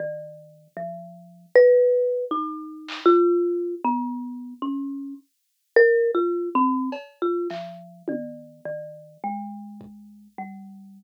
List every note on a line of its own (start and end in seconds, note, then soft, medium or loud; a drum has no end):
0.00 0.68 D#3 medium
0.77 1.46 F3 medium
1.56 2.25 B4 loud
1.73 kick medium
2.31 3.00 D#4 medium
2.88 clap medium
3.06 3.75 F4 loud
3.84 4.54 B3 medium
4.62 5.14 C#4 medium
5.76 6.11 A#4 loud
6.15 6.49 F4 medium
6.55 6.90 C4 medium
6.92 cowbell medium
7.22 7.48 F4 medium
7.50 8.02 F3 medium
7.50 clap medium
8.08 8.61 D#3 medium
8.08 high tom medium
8.65 9.17 D#3 medium
9.24 10.28 G#3 medium
9.81 kick medium
10.38 11.03 G3 soft